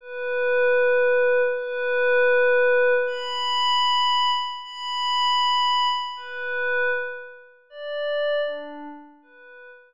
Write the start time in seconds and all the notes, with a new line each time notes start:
0.01 B4
1.54 B4
3.07 B5
4.62 B5
6.16 B4
7.70 D5
8.46 D4
9.22 B4